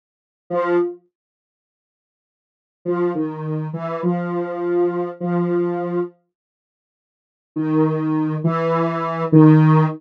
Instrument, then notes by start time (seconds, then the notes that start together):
lead 1 (square)
0.50 F3
2.85 F3
3.15 D#3
3.73 E3
4.03 F3
5.20 F3
7.56 D#3
8.44 E3
9.32 D#3